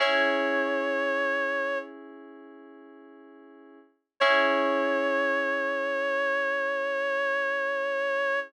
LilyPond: <<
  \new Staff \with { instrumentName = "Clarinet" } { \time 4/4 \key cis \minor \tempo 4 = 57 cis''2 r2 | cis''1 | }
  \new Staff \with { instrumentName = "Electric Piano 2" } { \time 4/4 \key cis \minor <cis' e' gis'>1 | <cis' e' gis'>1 | }
>>